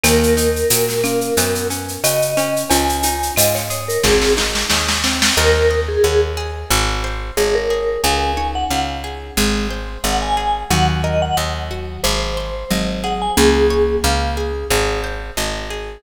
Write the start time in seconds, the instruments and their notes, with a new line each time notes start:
0.04 electric bass (finger) D#2, acoustic guitar (steel) A#3, marimba A#3, vibraphone A#4, cowbell, claves, shaker
0.23 shaker
0.37 acoustic guitar (steel) D#4, shaker
0.56 shaker
0.70 electric bass (finger) A#2, acoustic guitar (steel) F#4, tambourine, cowbell, shaker
0.89 snare, shaker
1.04 acoustic guitar (steel) A#3, marimba C#4, claves, shaker
1.21 shaker
1.37 electric bass (finger) F#2, acoustic guitar (steel) B3, marimba B4, cowbell, shaker
1.55 shaker
1.70 acoustic guitar (steel) C#4, shaker
1.88 shaker
2.04 electric bass (finger) C#3, acoustic guitar (steel) F#4, vibraphone D#5, tambourine, cowbell, claves, shaker
2.22 shaker
2.37 acoustic guitar (steel) C#4, cowbell, shaker
2.56 shaker
2.70 electric bass (finger) C#2, marimba C#4 F4, vibraphone G#5, cowbell, shaker
2.89 shaker
3.03 acoustic guitar (steel) D#4, shaker
3.23 shaker
3.36 electric bass (finger) G#2, acoustic guitar (steel) F4, vibraphone D#5, tambourine, cowbell, claves, shaker
3.55 vibraphone C#5, snare, shaker
3.70 acoustic guitar (steel) G#4, shaker
3.88 vibraphone A#4, shaker
4.03 electric bass (finger) G#1, acoustic guitar (steel) C4, vibraphone G#4, kick, snare
4.22 snare
4.37 acoustic guitar (steel) D#4, snare
4.55 snare
4.70 electric bass (finger) D#2, acoustic guitar (steel) G#4, snare
4.89 snare
5.04 acoustic guitar (steel) C4, snare
5.22 snare
5.37 electric bass (finger) D#2, vibraphone A#4, acoustic guitar (steel) A#4, marimba C5 D#5
5.71 acoustic guitar (steel) D#5
5.88 vibraphone G#4
6.04 electric bass (finger) D#2, vibraphone G#4, acoustic guitar (steel) F#5
6.37 acoustic guitar (steel) G#4
6.71 electric bass (finger) G#1
7.04 acoustic guitar (steel) C5
7.37 electric bass (finger) G#1, vibraphone G#4, marimba C#5, acoustic guitar (steel) D#5
7.55 vibraphone A#4
7.70 acoustic guitar (steel) G#4
8.04 electric bass (finger) C#2, marimba C#4, acoustic guitar (steel) G#4, vibraphone G#5
8.37 marimba D#4, acoustic guitar (steel) C#5
8.55 vibraphone F#5
8.71 electric bass (finger) C#2, acoustic guitar (steel) F5, vibraphone F#5
9.04 acoustic guitar (steel) G#4
9.37 electric bass (finger) G#1, marimba G#3, acoustic guitar (steel) G#4
9.71 acoustic guitar (steel) C5
10.04 electric bass (finger) G#1, acoustic guitar (steel) D#5, vibraphone F#5
10.22 vibraphone G#5
10.37 acoustic guitar (steel) G#4
10.71 electric bass (finger) D#2, marimba D#3 F#3, acoustic guitar (steel) F#4, vibraphone F#5
11.04 acoustic guitar (steel) A#4, vibraphone D#5
11.22 vibraphone F#5
11.37 electric bass (finger) D#2, acoustic guitar (steel) D#5
11.71 acoustic guitar (steel) F#4
12.04 electric bass (finger) G#1, acoustic guitar (steel) G#4, vibraphone C5
12.37 acoustic guitar (steel) C5
12.71 electric bass (finger) G#1, marimba F#3, acoustic guitar (steel) D#5
13.04 acoustic guitar (steel) G#4, vibraphone F#5
13.22 vibraphone G#5
13.37 electric bass (finger) C#2, marimba A#3 C#4, vibraphone G#4, acoustic guitar (steel) G#4
13.70 acoustic guitar (steel) C#5
14.04 electric bass (finger) C#2, acoustic guitar (steel) F5
14.37 acoustic guitar (steel) G#4
14.70 electric bass (finger) G#1, acoustic guitar (steel) G#4
15.04 acoustic guitar (steel) C5
15.37 electric bass (finger) G#1, acoustic guitar (steel) D#5
15.70 acoustic guitar (steel) G#4